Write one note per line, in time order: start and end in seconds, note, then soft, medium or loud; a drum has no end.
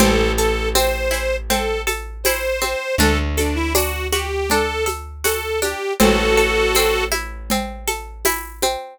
0.00 2.75 A1 loud
0.00 0.75 C4 loud
0.00 0.32 A4 loud
0.00 cowbell medium
0.00 low conga loud
0.00 shaker medium
0.37 0.69 A4 medium
0.37 1.86 A4 medium
0.37 shaker medium
0.75 1.50 C4 medium
0.75 1.36 C5 medium
0.75 tambourine medium
0.75 high conga medium
0.75 shaker medium
1.11 2.25 E4 medium
1.11 cowbell medium
1.11 shaker medium
1.50 2.61 C4 medium
1.50 1.81 A4 medium
1.50 cowbell medium
1.50 low conga medium
1.50 shaker medium
1.87 2.94 A4 medium
1.87 high conga medium
1.87 shaker medium
2.24 2.97 E4 medium
2.24 2.95 C5 medium
2.24 tambourine medium
2.24 cowbell medium
2.24 high conga medium
2.24 shaker medium
2.62 2.97 C4 medium
2.62 high conga medium
2.62 shaker medium
2.98 5.74 D2 loud
2.98 3.74 D4 loud
2.98 3.18 A4 loud
2.98 cowbell medium
2.98 low conga medium
2.98 shaker medium
3.37 3.56 D4 medium
3.37 4.86 A4 medium
3.37 high conga medium
3.37 shaker medium
3.55 3.73 E4 loud
3.75 4.50 D4 medium
3.75 4.07 F#4 medium
3.75 tambourine medium
3.75 cowbell medium
3.75 high conga medium
3.75 shaker medium
4.12 5.24 F#4 medium
4.12 4.49 G4 medium
4.12 high conga medium
4.12 shaker medium
4.50 5.62 D4 medium
4.50 4.84 A4 medium
4.50 cowbell medium
4.50 low conga medium
4.50 shaker medium
4.86 5.93 A4 medium
4.86 high conga medium
4.86 shaker medium
5.24 5.95 F#4 medium
5.24 5.60 A4 medium
5.24 tambourine medium
5.24 cowbell medium
5.24 high conga medium
5.24 shaker medium
5.62 5.98 D4 medium
5.62 5.93 G4 medium
5.62 high conga medium
5.62 shaker medium
6.00 8.76 A1 loud
6.00 6.75 C4 medium
6.00 7.04 F#4 loud
6.00 7.04 A4 loud
6.00 cowbell medium
6.00 low conga loud
6.00 shaker medium
6.37 7.87 A4 medium
6.37 shaker medium
6.75 7.51 C4 medium
6.75 tambourine medium
6.75 cowbell medium
6.75 high conga medium
6.75 shaker medium
7.12 8.25 E4 medium
7.12 high conga medium
7.12 shaker medium
7.50 8.62 C4 medium
7.50 cowbell medium
7.50 low conga medium
7.50 shaker medium
7.88 8.94 A4 medium
7.88 high conga medium
7.88 shaker medium
8.25 8.97 E4 medium
8.25 tambourine medium
8.25 cowbell medium
8.25 high conga medium
8.25 shaker medium
8.62 8.98 C4 medium
8.62 high conga medium
8.62 shaker medium